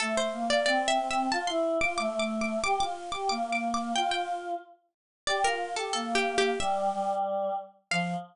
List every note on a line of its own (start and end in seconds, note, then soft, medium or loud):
0.00 0.27 A3 medium
0.00 0.15 A4 loud
0.17 0.48 C5 medium
0.33 0.63 A#3 medium
0.50 0.65 D5 medium
0.66 0.97 C4 medium
0.66 0.87 D5 medium
0.88 1.09 E5 loud
0.99 1.26 C4 medium
1.11 1.31 E5 medium
1.32 1.47 F4 medium
1.32 1.47 A5 loud
1.47 1.78 E4 medium
1.47 1.77 C6 medium
1.81 1.98 F4 medium
1.81 1.97 D6 medium
1.98 2.57 A3 medium
1.98 2.19 D6 medium
2.20 2.40 D6 medium
2.41 2.62 D6 medium
2.64 2.79 G4 medium
2.64 2.79 D6 loud
2.80 3.10 F4 medium
2.80 3.12 D6 loud
3.12 3.29 G4 medium
3.12 3.28 D6 medium
3.29 3.92 A#3 medium
3.29 3.50 D6 loud
3.52 3.73 D6 medium
3.74 3.95 D6 medium
3.95 4.54 F4 medium
3.95 4.11 G5 medium
4.11 4.85 G5 medium
5.27 5.43 G4 medium
5.27 5.43 D5 medium
5.44 5.74 F4 medium
5.44 5.75 A#4 medium
5.76 5.93 G4 medium
5.76 5.92 A4 medium
5.93 6.50 A#3 medium
5.93 6.14 A4 medium
6.15 6.36 G4 medium
6.38 6.59 G4 medium
6.60 6.89 G3 medium
6.60 7.16 E5 loud
6.92 7.53 G3 medium
7.91 8.14 F3 loud
7.91 8.14 F5 loud